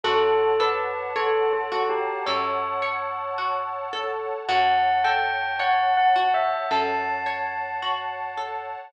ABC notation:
X:1
M:4/4
L:1/8
Q:1/4=54
K:F#phr
V:1 name="Tubular Bells"
A B (3A A G c4 | f g (3f f e a4 |]
V:2 name="Orchestral Harp"
F A c F A c F A | F A c F A c F A |]
V:3 name="Pad 2 (warm)"
[cfa]8 | [cfa]8 |]
V:4 name="Electric Bass (finger)" clef=bass
F,,4 F,,4 | F,,4 F,,4 |]